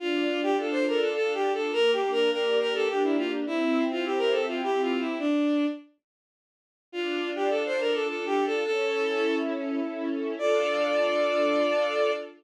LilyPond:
<<
  \new Staff \with { instrumentName = "Violin" } { \time 3/4 \key d \minor \tempo 4 = 104 f'8. g'16 a'16 c''16 bes'16 a'16 \tuplet 3/2 { a'8 g'8 a'8 } | \tuplet 3/2 { bes'8 g'8 bes'8 } bes'8 bes'16 a'16 g'16 e'16 f'16 r16 | e'8. f'16 g'16 bes'16 a'16 f'16 \tuplet 3/2 { g'8 f'8 e'8 } | d'4 r2 |
f'8. g'16 a'16 c''16 bes'16 a'16 \tuplet 3/2 { a'8 g'8 a'8 } | a'4. r4. | d''2. | }
  \new Staff \with { instrumentName = "String Ensemble 1" } { \time 3/4 \key d \minor d'8 f'8 a'8 f'8 d'8 f'8 | bes8 d'8 g'8 d'8 bes8 d'8 | c'8 e'8 g'8 e'8 c'8 e'8 | r2. |
d'8 f'8 a'8 f'8 d'8 f'8 | cis'8 e'8 a'8 e'8 cis'8 e'8 | <d' f' a'>2. | }
>>